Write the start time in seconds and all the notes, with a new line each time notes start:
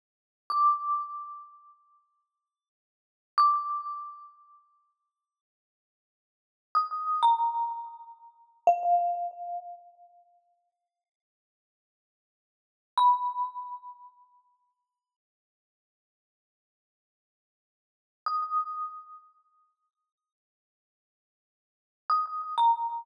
0.50 D6
3.38 D6
6.75 D#6
7.23 A#5
8.67 F5
12.97 B5
18.26 D#6
22.10 D#6
22.58 A#5